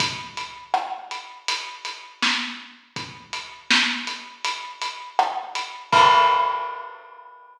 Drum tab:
CC |--------|--------|x-------|
HH |xx-xxx--|xx-xxx-x|--------|
SD |--r---o-|--o---r-|--------|
BD |o-------|o-------|o-------|